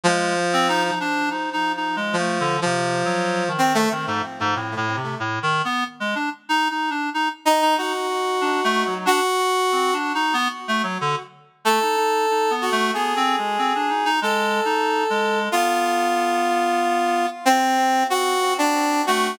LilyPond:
<<
  \new Staff \with { instrumentName = "Brass Section" } { \time 6/4 \tempo 4 = 93 f4. r4. r16 f8. f4. c'16 a16 | r1 r4. ees'8 | ges'2 ges'4. r2 r8 | a'4. ges'8 aes'2 a'2 |
f'2. c'4 ges'8. d'8. ges'8 | }
  \new Staff \with { instrumentName = "Clarinet" } { \time 6/4 aes8 r16 c'16 ees'16 ees'16 d'8 \tuplet 3/2 { ees'8 ees'8 ees'8 aes8 a8 d8 c4 ges4 ees4 } | ees16 aes,16 r16 aes,16 \tuplet 3/2 { a,8 a,8 c8 a,8 ees8 b8 } r16 aes16 d'16 r16 \tuplet 3/2 { ees'8 ees'8 d'8 } ees'16 r8 ees'16 | ees'16 r8. \tuplet 3/2 { d'8 a8 ges8 } d'16 r8. \tuplet 3/2 { c'8 d'8 ees'8 } b16 r16 a16 ges16 d16 r8. | a16 ees'16 ees'8 \tuplet 3/2 { ees'8 b8 a8 b8 c'8 aes8 } c'16 d'16 ees'16 ees'16 \tuplet 3/2 { aes4 ees'4 aes4 } |
b2. r2 r8 a8 | }
>>